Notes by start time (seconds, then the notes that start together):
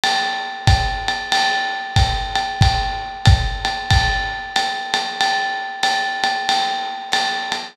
0.04 ride
0.67 kick, hi-hat pedal, ride
1.08 ride
1.32 ride
1.96 kick, hi-hat pedal, ride
2.35 ride
2.61 kick, ride
3.25 kick, hi-hat pedal, ride
3.65 ride
3.90 kick, ride
4.56 hi-hat pedal, ride
4.94 ride
5.21 ride
5.83 hi-hat pedal, ride
6.24 ride
6.49 ride
7.12 hi-hat pedal, ride
7.52 ride